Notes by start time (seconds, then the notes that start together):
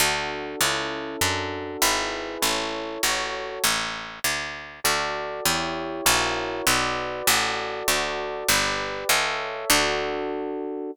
0.00 D2 D4 F#4 A4
0.61 C#2 C#4 E4 A4
1.21 F#2 D4 F#4 A4
1.82 G#1 E4 G#4 B4
2.42 A1 E4 A4 C#5
3.03 A1 F#4 A4 C#5
3.64 A1
4.24 D2
4.84 D2 F#4 A4 D5
5.45 E2 E4 G4 C#5
6.06 A#1 E4 F#4 A#4 C#5
6.67 B1 F#4 B4 D5
7.27 A1 F#4 A4 D5
7.88 D2 F#4 A4 D5
8.48 G1 G4 B4 D5
9.09 C#2 A4 C#5 E5
9.70 D2 D4 F#4 A4